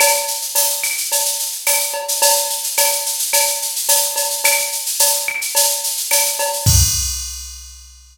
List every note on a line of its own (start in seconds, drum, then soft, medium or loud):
0.00 cowbell loud
0.00 claves loud
0.00 shaker loud
0.14 shaker medium
0.28 shaker medium
0.41 shaker medium
0.55 tambourine loud
0.55 cowbell medium
0.55 shaker loud
0.70 shaker medium
0.83 claves loud
0.83 shaker medium
0.97 shaker medium
1.12 cowbell medium
1.12 shaker loud
1.25 shaker loud
1.39 shaker medium
1.52 shaker medium
1.67 tambourine medium
1.67 cowbell medium
1.67 claves loud
1.67 shaker loud
1.80 shaker medium
1.94 cowbell medium
2.08 shaker loud
2.22 cowbell loud
2.22 shaker loud
2.36 shaker loud
2.50 shaker medium
2.64 shaker medium
2.77 tambourine medium
2.77 cowbell loud
2.77 claves medium
2.77 shaker loud
2.92 shaker medium
3.06 shaker loud
3.19 shaker loud
3.33 cowbell loud
3.33 claves medium
3.33 shaker loud
3.47 shaker medium
3.62 shaker medium
3.76 shaker medium
3.89 tambourine medium
3.89 cowbell medium
3.89 shaker loud
4.02 shaker medium
4.16 cowbell medium
4.16 shaker loud
4.30 shaker medium
4.44 cowbell loud
4.44 claves loud
4.44 shaker loud
4.59 shaker medium
4.72 shaker medium
4.86 shaker medium
4.99 tambourine medium
4.99 cowbell medium
4.99 shaker loud
5.14 shaker medium
5.28 claves loud
5.41 shaker medium
5.55 cowbell loud
5.55 shaker loud
5.69 shaker medium
5.84 shaker loud
5.97 shaker medium
6.11 tambourine medium
6.11 cowbell medium
6.11 claves loud
6.11 shaker loud
6.26 shaker medium
6.39 cowbell loud
6.39 shaker medium
6.53 shaker medium
6.66 kick loud
6.66 crash loud